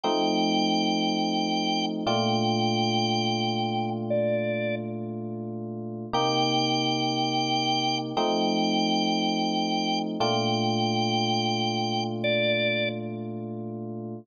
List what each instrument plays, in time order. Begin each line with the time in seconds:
0.03 electric piano 1 F3 A3 C4 D#4, drawbar organ G5
2.06 electric piano 1 A#2 A3 D4 F4, drawbar organ G5
4.10 drawbar organ D5
6.13 electric piano 1 C3 A#3 D#4 G4, drawbar organ G5
8.17 electric piano 1 F3 A3 C4 D#4, drawbar organ G5
10.20 electric piano 1 A#2 A3 D4 F4, drawbar organ G5
12.24 drawbar organ D5